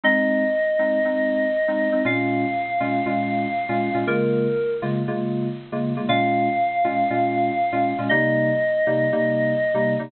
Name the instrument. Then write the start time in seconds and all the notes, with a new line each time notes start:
electric piano 2
0.03 G#3 C4 D#4 D#5
0.79 G#3 C4 D#4
1.05 G#3 C4 D#4
1.68 G#3 C4 D#4
1.92 G#3 C4 D#4
2.05 A#2 G#3 C#4 F4 F5
2.80 A#2 G#3 C#4 F4
3.06 A#2 G#3 C#4 F4
3.69 A#2 G#3 C#4 F4
3.94 A#2 G#3 C#4 F4
4.07 C#3 G#3 A#3 F4 A#4
4.82 C#3 G#3 A#3 F4
5.08 C#3 G#3 A#3 F4
5.72 C#3 G#3 A#3 F4
5.96 C#3 G#3 A#3 F4
6.08 A#2 G#3 C#4 F4 F5
6.84 A#2 G#3 C#4 F4
7.10 A#2 G#3 C#4 F4
7.72 A#2 G#3 C#4 F4
7.98 A#2 G#3 C#4 F4
8.09 C3 G3 A#3 D#4 D#5
8.87 C3 G3 A#3 D#4
9.12 C3 G3 A#3 D#4
9.74 C3 G3 A#3 D#4
9.99 C3 G3 A#3 D#4